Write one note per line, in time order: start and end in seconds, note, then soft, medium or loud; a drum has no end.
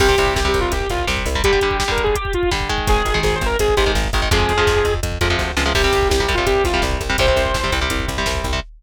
0.00 0.15 C2 medium
0.00 0.08 C3 medium
0.00 0.08 G3 medium
0.00 0.34 G4 loud
0.00 kick loud
0.00 crash loud
0.08 0.16 C3 medium
0.08 0.16 G3 medium
0.08 kick loud
0.18 0.33 C2 medium
0.18 0.40 C3 medium
0.18 0.40 G3 medium
0.18 kick medium
0.18 closed hi-hat medium
0.27 kick medium
0.36 0.51 C2 medium
0.36 0.48 G4 loud
0.36 kick loud
0.36 snare loud
0.45 0.74 C3 medium
0.45 0.74 G3 medium
0.45 0.60 G4 loud
0.45 kick medium
0.54 0.69 C2 medium
0.54 kick medium
0.54 closed hi-hat medium
0.61 0.72 F4 medium
0.61 kick medium
0.72 0.87 C2 medium
0.72 0.89 G4 medium
0.72 kick medium
0.72 closed hi-hat loud
0.81 kick medium
0.90 1.05 C2 medium
0.90 1.06 F4 loud
0.90 kick medium
0.90 closed hi-hat medium
0.99 kick medium
1.07 1.23 C2 medium
1.07 1.29 C3 medium
1.07 1.29 G3 medium
1.07 kick loud
1.07 snare loud
1.17 kick loud
1.26 1.41 C2 medium
1.26 kick medium
1.26 open hi-hat medium
1.35 1.42 C3 medium
1.35 1.42 G3 medium
1.35 kick medium
1.44 1.52 D3 loud
1.44 1.52 G3 loud
1.44 1.76 G4 loud
1.44 kick loud
1.44 closed hi-hat loud
1.53 1.60 D3 medium
1.53 1.60 G3 medium
1.53 kick medium
1.61 1.84 D3 medium
1.61 1.84 G3 medium
1.61 kick medium
1.61 closed hi-hat medium
1.71 kick loud
1.79 1.91 G4 loud
1.79 kick medium
1.79 snare loud
1.88 2.17 D3 medium
1.88 2.17 G3 medium
1.88 2.03 A#4 loud
1.88 kick medium
1.97 kick medium
1.97 closed hi-hat medium
2.04 2.15 G#4 loud
2.04 kick loud
2.15 2.33 G4 loud
2.15 kick loud
2.15 closed hi-hat loud
2.25 kick loud
2.33 2.50 F4 loud
2.33 kick medium
2.33 closed hi-hat medium
2.43 kick medium
2.51 2.69 D3 medium
2.51 2.69 G3 medium
2.51 kick loud
2.51 snare loud
2.60 kick medium
2.69 3.09 D#3 medium
2.69 3.09 G#3 medium
2.69 kick loud
2.69 closed hi-hat medium
2.78 kick loud
2.87 3.03 G#1 medium
2.87 3.19 G#4 loud
2.87 kick loud
2.87 closed hi-hat loud
2.96 kick medium
3.05 3.21 G#1 medium
3.05 kick medium
3.05 closed hi-hat medium
3.14 3.43 D#3 medium
3.14 3.43 G#3 medium
3.14 kick medium
3.23 3.39 G#1 medium
3.23 3.35 G#4 loud
3.23 kick loud
3.23 snare loud
3.32 3.47 C5 loud
3.32 kick medium
3.41 3.57 G#1 medium
3.41 kick loud
3.41 closed hi-hat medium
3.46 3.57 A#4 loud
3.51 kick medium
3.59 3.75 G#1 medium
3.59 3.75 G#4 loud
3.59 kick medium
3.59 closed hi-hat loud
3.68 kick medium
3.77 3.93 G#1 medium
3.77 3.84 D#3 medium
3.77 3.84 G#3 medium
3.77 3.91 G4 loud
3.77 kick loud
3.77 closed hi-hat medium
3.86 4.08 D#3 medium
3.86 4.08 G#3 medium
3.86 kick medium
3.95 4.10 G#1 medium
3.95 kick loud
3.95 snare loud
4.04 kick medium
4.13 4.28 G#1 medium
4.13 4.21 D#3 medium
4.13 4.21 G#3 medium
4.13 kick loud
4.13 closed hi-hat medium
4.22 4.29 D#3 medium
4.22 4.29 G#3 medium
4.22 kick loud
4.31 4.46 F2 medium
4.31 4.53 C3 medium
4.31 4.53 F3 medium
4.31 4.53 G#3 medium
4.31 4.93 G#4 loud
4.31 kick loud
4.31 closed hi-hat loud
4.40 kick loud
4.49 4.64 F2 medium
4.49 kick medium
4.49 closed hi-hat medium
4.58 4.86 C3 medium
4.58 4.86 F3 medium
4.58 4.86 G#3 medium
4.58 kick medium
4.67 4.82 F2 medium
4.67 kick loud
4.67 snare loud
4.76 kick medium
4.85 5.00 F2 medium
4.85 kick loud
4.85 closed hi-hat medium
4.94 kick medium
5.03 5.18 F2 medium
5.03 kick loud
5.03 closed hi-hat loud
5.12 kick medium
5.21 5.36 F2 medium
5.21 5.28 C3 medium
5.21 5.28 F3 medium
5.21 5.28 G#3 medium
5.21 kick medium
5.21 closed hi-hat loud
5.30 5.52 C3 medium
5.30 5.52 F3 medium
5.30 5.52 G#3 medium
5.30 kick medium
5.39 5.55 D2 medium
5.39 kick medium
5.39 snare medium
5.57 5.73 C#2 medium
5.57 5.64 C3 medium
5.57 5.64 F3 medium
5.57 5.64 G#3 medium
5.57 snare loud
5.66 5.73 C3 medium
5.66 5.73 F3 medium
5.66 5.73 G#3 medium
5.75 5.90 C2 medium
5.75 5.82 C3 medium
5.75 5.82 G3 medium
5.75 6.08 G4 loud
5.75 kick loud
5.75 crash loud
5.84 6.13 C3 medium
5.84 6.13 G3 medium
5.84 kick loud
5.93 6.08 C2 medium
5.93 kick loud
5.93 closed hi-hat medium
6.02 kick medium
6.09 6.26 C2 medium
6.09 6.21 G4 loud
6.09 kick loud
6.09 snare loud
6.20 6.27 C3 medium
6.20 6.27 G3 medium
6.20 6.33 G4 medium
6.20 kick medium
6.28 6.44 C2 medium
6.28 6.36 C3 medium
6.28 6.36 G3 medium
6.28 kick medium
6.28 closed hi-hat medium
6.34 6.66 C3 medium
6.34 6.66 G3 medium
6.34 6.46 F4 loud
6.34 kick loud
6.46 6.62 C2 medium
6.46 6.63 G4 loud
6.46 kick loud
6.46 closed hi-hat loud
6.56 kick medium
6.64 6.80 C2 medium
6.64 6.82 F4 loud
6.64 kick loud
6.64 closed hi-hat medium
6.74 7.02 C3 medium
6.74 7.02 G3 medium
6.74 kick medium
6.82 6.98 C2 medium
6.82 kick loud
6.82 snare loud
6.91 kick medium
7.01 7.16 C2 medium
7.01 kick medium
7.01 closed hi-hat medium
7.10 7.17 C3 medium
7.10 7.17 G3 medium
7.10 kick medium
7.18 7.34 C2 medium
7.18 7.26 C3 medium
7.18 7.26 G3 medium
7.18 7.73 C5 loud
7.18 kick loud
7.18 closed hi-hat loud
7.27 7.57 C3 medium
7.27 7.57 G3 medium
7.27 kick loud
7.36 7.52 C2 medium
7.36 kick medium
7.36 closed hi-hat medium
7.46 kick loud
7.54 7.70 C2 medium
7.54 kick loud
7.54 snare loud
7.64 7.71 C3 medium
7.64 7.71 G3 medium
7.64 kick medium
7.72 7.88 C2 medium
7.72 7.80 C3 medium
7.72 7.80 G3 medium
7.72 kick medium
7.72 closed hi-hat medium
7.81 8.10 C3 medium
7.81 8.10 G3 medium
7.81 kick medium
7.90 8.06 C2 medium
7.90 kick loud
7.90 closed hi-hat loud
8.00 kick loud
8.08 8.24 C2 medium
8.08 kick medium
8.08 closed hi-hat medium
8.17 8.47 C3 medium
8.17 8.47 G3 medium
8.17 kick medium
8.26 8.42 C2 medium
8.26 kick medium
8.26 snare loud
8.35 kick loud
8.44 8.60 C2 medium
8.44 kick loud
8.44 closed hi-hat medium
8.53 8.60 C3 medium
8.53 8.60 G3 medium
8.53 kick medium